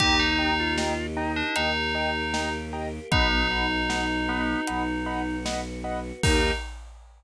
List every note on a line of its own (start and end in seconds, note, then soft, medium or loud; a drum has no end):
0.00 1.42 D#2 medium
0.00 1.54 A#3 medium
0.00 0.51 D#4 loud
0.00 1.55 D#4 medium
0.00 0.19 G4 loud
0.00 1.54 G4 medium
0.00 0.16 D#5 loud
0.00 0.16 G5 loud
0.00 0.16 A#5 loud
0.00 kick medium
0.00 closed hi-hat medium
0.19 0.73 D#4 loud
0.39 0.54 D#5 medium
0.39 0.54 G5 medium
0.39 0.54 A#5 medium
0.59 1.06 F4 loud
0.78 0.94 D#5 medium
0.78 0.94 G5 medium
0.78 0.94 A#5 medium
0.78 snare loud
1.17 1.54 D#4 medium
1.17 1.32 D#5 medium
1.17 1.32 G5 medium
1.17 1.32 A#5 medium
1.36 1.55 D4 medium
1.55 2.99 D#2 medium
1.55 3.09 A#3 medium
1.55 2.53 D#4 loud
1.55 3.09 G4 medium
1.55 3.09 A#4 medium
1.55 1.71 D#5 medium
1.55 1.71 G5 medium
1.55 1.71 A#5 medium
1.55 closed hi-hat medium
1.95 2.10 D#5 medium
1.95 2.10 G5 medium
1.95 2.10 A#5 medium
2.34 2.49 D#5 medium
2.34 2.49 G5 medium
2.34 2.49 A#5 medium
2.34 snare medium
2.73 2.88 D#5 medium
2.73 2.88 G5 medium
2.73 2.88 A#5 medium
3.12 4.55 B1 medium
3.12 3.47 B3 loud
3.12 4.66 B3 medium
3.12 5.36 D#4 loud
3.12 4.66 D#4 medium
3.12 4.66 F#4 medium
3.12 3.27 D#5 loud
3.12 3.27 F#5 loud
3.12 3.27 B5 medium
3.12 kick loud
3.12 closed hi-hat medium
3.51 3.66 D#5 medium
3.51 3.66 F#5 medium
3.51 3.66 B5 medium
3.89 4.05 D#5 medium
3.89 4.05 F#5 medium
3.89 4.05 B5 medium
3.89 snare medium
4.28 4.61 B3 loud
4.28 4.44 D#5 medium
4.28 4.44 F#5 medium
4.28 4.44 B5 medium
4.67 6.12 B1 medium
4.67 6.21 B3 medium
4.67 6.21 F#4 medium
4.67 6.21 B4 medium
4.67 4.83 D#5 medium
4.67 4.83 F#5 medium
4.67 4.83 B5 medium
4.67 closed hi-hat medium
5.06 5.22 D#5 medium
5.06 5.22 F#5 loud
5.06 5.22 B5 medium
5.45 5.61 D#5 medium
5.45 5.61 F#5 medium
5.45 5.61 B5 medium
5.45 snare loud
5.84 6.00 D#5 medium
5.84 6.00 F#5 medium
5.84 6.00 B5 medium
6.23 6.51 D#2 loud
6.23 6.52 A#3 loud
6.23 6.51 D#4 loud
6.23 6.52 D#4 loud
6.23 6.51 G4 loud
6.23 6.52 G4 loud
6.23 6.51 A#4 loud
6.23 kick loud
6.23 crash loud